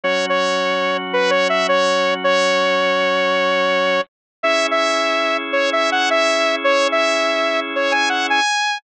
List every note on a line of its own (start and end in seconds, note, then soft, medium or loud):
0.04 4.00 F#3 medium
0.04 4.00 C#4 loud
0.04 4.00 F#4 medium
0.04 0.26 C#5 medium
0.29 0.97 C#5 medium
1.13 1.31 B4 medium
1.30 1.48 C#5 medium
1.49 1.67 E5 medium
1.69 2.14 C#5 medium
2.24 4.01 C#5 loud
4.43 8.40 C#4 loud
4.43 8.40 E4 loud
4.43 8.40 G#4 medium
4.43 4.67 E5 loud
4.71 5.37 E5 medium
5.53 5.70 C#5 medium
5.73 5.90 E5 medium
5.92 6.09 F#5 medium
6.10 6.56 E5 loud
6.64 6.88 C#5 loud
6.92 7.60 E5 medium
7.76 7.93 C#5 medium
7.92 8.09 G#5 medium
8.09 8.27 F#5 medium
8.30 8.78 G#5 loud